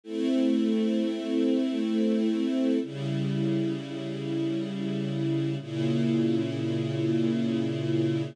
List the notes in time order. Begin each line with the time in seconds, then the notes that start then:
0.04 A3 C4 E4
2.81 C#3 G3 E4
5.59 A#2 C#3 E4